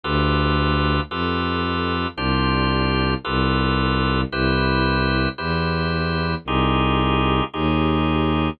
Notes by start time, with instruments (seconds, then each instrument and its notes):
0.04 violin D2, drawbar organ F4 G4 A4 B4
1.10 violin F2, drawbar organ F4 G4 A4 B4
2.16 violin C2, drawbar organ D4 F4 G4 C5
3.25 violin C2, drawbar organ F4 G4 A4 B4
4.31 violin C2, drawbar organ E4 G4 B4 C5
5.38 violin E2, drawbar organ E4 G4 B4 C5
6.45 violin C2, drawbar organ D#4 F4 G4 G#4
7.54 violin D#2, drawbar organ D#4 F4 G4 G#4